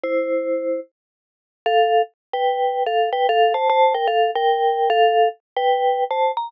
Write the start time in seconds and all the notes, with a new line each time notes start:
0.04 E4 C5
1.66 A4 F5
2.33 B4 G5
2.86 A4 F5
3.13 B4 G5
3.29 A4 F5
3.54 C5 A5
3.70 C5 A5
3.95 A#4 G5
4.08 A4 F5
4.35 A#4 G5
4.90 A4 F5
5.57 B4 G5
6.11 C5 A5
6.37 A#5